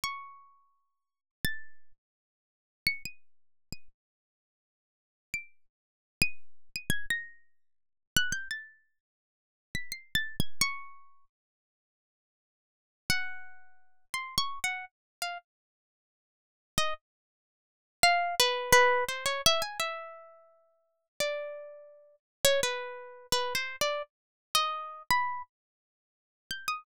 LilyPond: \new Staff { \time 2/4 \tempo 4 = 85 cis'''2 | a'''8. r4 r16 | cis''''16 dis''''4 dis''''16 r8 | r4. d''''8 |
r8. dis''''8. dis''''16 gis'''16 | ais'''4. fis'''16 g'''16 | a'''8. r4 b'''16 | \tuplet 3/2 { c''''8 a'''8 gis'''8 } cis'''4 |
r2 | r8 fis''4. | \tuplet 3/2 { c'''8 cis'''8 fis''8 } r8 f''16 r16 | r4. r16 dis''16 |
r4. f''8 | b'8 b'8 c''16 cis''16 e''16 gis''16 | e''2 | d''4. r16 cis''16 |
b'4 \tuplet 3/2 { b'8 c''8 d''8 } | r8. dis''8. b''8 | r4. g'''16 dis'''16 | }